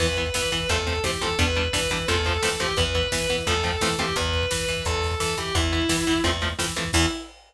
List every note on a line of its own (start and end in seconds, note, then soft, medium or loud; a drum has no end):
0.00 0.29 E2 medium
0.00 0.07 E3 loud
0.00 0.07 B3 loud
0.00 0.29 B4 medium
0.00 kick medium
0.00 crash medium
0.09 kick medium
0.17 0.24 E3 medium
0.17 0.24 B3 medium
0.17 kick medium
0.17 closed hi-hat medium
0.26 kick medium
0.34 0.42 E3 medium
0.34 0.50 E3 medium
0.34 0.42 B3 medium
0.34 0.68 B4 medium
0.34 kick medium
0.34 snare loud
0.43 kick medium
0.51 0.67 E3 medium
0.51 0.59 E3 medium
0.51 0.59 B3 medium
0.51 kick medium
0.51 closed hi-hat medium
0.60 kick medium
0.69 0.99 E2 medium
0.69 0.77 F3 loud
0.69 0.77 A3 loud
0.69 0.77 C4 medium
0.69 0.98 A4 medium
0.69 kick medium
0.69 closed hi-hat loud
0.78 kick medium
0.87 0.94 F3 medium
0.87 0.94 A3 medium
0.87 0.94 C4 medium
0.87 kick medium
0.87 snare soft
0.87 closed hi-hat medium
0.96 kick medium
1.04 1.19 E3 medium
1.04 1.11 F3 medium
1.04 1.11 A3 medium
1.04 1.11 C4 medium
1.04 1.21 G4 medium
1.04 kick medium
1.04 snare medium
1.13 kick medium
1.21 1.36 E3 medium
1.21 1.28 F3 medium
1.21 1.28 A3 medium
1.21 1.28 C4 medium
1.21 1.38 A4 medium
1.21 kick medium
1.21 closed hi-hat medium
1.30 kick medium
1.39 1.68 E2 medium
1.39 1.46 G3 medium
1.39 1.46 B3 loud
1.39 1.46 D4 medium
1.39 1.68 B4 medium
1.39 kick loud
1.39 closed hi-hat medium
1.48 kick medium
1.56 1.63 G3 medium
1.56 1.63 B3 medium
1.56 1.63 D4 medium
1.56 kick medium
1.56 closed hi-hat medium
1.65 kick medium
1.73 1.88 E3 medium
1.73 1.80 G3 medium
1.73 1.80 B3 loud
1.73 1.80 D4 medium
1.73 2.03 B4 medium
1.73 kick medium
1.73 snare loud
1.83 kick medium
1.90 2.06 E3 medium
1.90 1.98 G3 medium
1.90 1.98 B3 medium
1.90 1.98 D4 medium
1.90 kick medium
1.90 closed hi-hat medium
1.99 kick medium
2.08 2.38 E2 medium
2.08 2.15 F3 loud
2.08 2.15 A3 medium
2.08 2.15 C4 loud
2.08 2.40 A4 medium
2.08 kick medium
2.08 closed hi-hat medium
2.16 kick medium
2.25 2.33 F3 medium
2.25 2.33 A3 medium
2.25 2.33 C4 medium
2.25 kick medium
2.25 snare soft
2.25 closed hi-hat medium
2.35 kick medium
2.42 2.57 E3 medium
2.42 2.49 F3 medium
2.42 2.49 A3 medium
2.42 2.49 C4 medium
2.42 2.57 A4 medium
2.42 kick medium
2.42 snare loud
2.52 kick medium
2.59 2.75 E3 medium
2.59 2.67 F3 medium
2.59 2.67 A3 medium
2.59 2.67 C4 medium
2.59 2.74 G4 medium
2.59 kick medium
2.59 closed hi-hat medium
2.68 kick medium
2.77 3.07 E2 medium
2.77 2.84 E3 loud
2.77 2.84 B3 loud
2.77 3.10 B4 medium
2.77 kick loud
2.77 closed hi-hat medium
2.86 kick medium
2.95 3.02 E3 medium
2.95 3.02 B3 medium
2.95 kick medium
2.95 closed hi-hat medium
3.03 kick medium
3.12 3.27 E3 medium
3.12 3.19 E3 medium
3.12 3.19 B3 medium
3.12 3.41 B4 medium
3.12 kick medium
3.12 snare loud
3.21 kick medium
3.29 3.37 E3 medium
3.29 3.44 E3 medium
3.29 3.37 B3 loud
3.29 kick medium
3.29 closed hi-hat medium
3.38 kick medium
3.47 3.76 E2 medium
3.47 3.54 F3 loud
3.47 3.54 A3 loud
3.47 3.54 C4 loud
3.47 3.80 A4 medium
3.47 kick medium
3.47 closed hi-hat medium
3.56 kick medium
3.63 3.71 F3 medium
3.63 3.71 A3 medium
3.63 3.71 C4 medium
3.63 kick medium
3.63 snare soft
3.63 closed hi-hat medium
3.72 kick medium
3.81 3.96 E3 medium
3.81 3.89 F3 medium
3.81 3.89 A3 medium
3.81 3.89 C4 medium
3.81 3.97 A4 medium
3.81 kick medium
3.81 snare medium
3.90 kick medium
3.98 4.13 E3 medium
3.98 4.06 F3 medium
3.98 4.06 A3 medium
3.98 4.06 C4 medium
3.98 4.14 G4 medium
3.98 kick medium
3.98 closed hi-hat medium
4.09 kick medium
4.16 4.46 E2 medium
4.16 4.47 B4 medium
4.16 kick medium
4.16 closed hi-hat loud
4.26 kick medium
4.33 kick medium
4.33 closed hi-hat medium
4.43 kick medium
4.51 4.66 E3 medium
4.51 4.83 B4 medium
4.51 kick medium
4.51 snare loud
4.60 kick medium
4.68 4.83 E3 medium
4.68 kick medium
4.68 closed hi-hat medium
4.77 kick medium
4.85 5.15 E2 medium
4.85 5.14 A4 medium
4.85 kick medium
4.85 closed hi-hat medium
4.94 kick medium
5.02 kick medium
5.02 snare medium
5.02 closed hi-hat medium
5.11 kick medium
5.20 5.35 E3 medium
5.20 5.35 A4 medium
5.20 kick medium
5.20 snare medium
5.29 kick medium
5.37 5.52 E3 medium
5.37 5.52 G4 medium
5.37 kick medium
5.37 closed hi-hat medium
5.46 kick medium
5.55 5.84 E2 medium
5.55 5.62 E3 loud
5.55 5.62 B3 loud
5.55 6.19 E4 medium
5.55 kick loud
5.55 closed hi-hat loud
5.63 kick medium
5.72 5.79 E3 medium
5.72 5.79 B3 medium
5.72 kick medium
5.72 closed hi-hat medium
5.82 kick medium
5.89 5.96 E3 medium
5.89 6.04 E3 medium
5.89 5.96 B3 loud
5.89 kick medium
5.89 snare loud
5.98 kick medium
6.07 6.22 E3 medium
6.07 6.14 E3 medium
6.07 6.14 B3 medium
6.07 kick medium
6.07 closed hi-hat medium
6.15 kick medium
6.24 6.54 E2 medium
6.24 6.31 F3 loud
6.24 6.31 A3 medium
6.24 6.31 C4 loud
6.24 kick medium
6.24 closed hi-hat medium
6.34 kick medium
6.41 6.49 F3 medium
6.41 6.49 A3 medium
6.41 6.49 C4 medium
6.41 kick medium
6.41 snare soft
6.41 closed hi-hat medium
6.49 kick medium
6.59 6.74 E3 medium
6.59 6.66 F3 medium
6.59 6.66 A3 medium
6.59 6.66 C4 medium
6.59 kick medium
6.59 snare loud
6.67 kick medium
6.76 6.91 E3 medium
6.76 6.84 F3 medium
6.76 6.84 A3 medium
6.76 6.84 C4 medium
6.76 kick medium
6.76 closed hi-hat medium
6.85 kick medium
6.93 7.06 E2 loud
6.93 7.06 E3 loud
6.93 7.06 B3 medium
6.93 7.06 E4 loud
6.93 kick loud
6.93 crash loud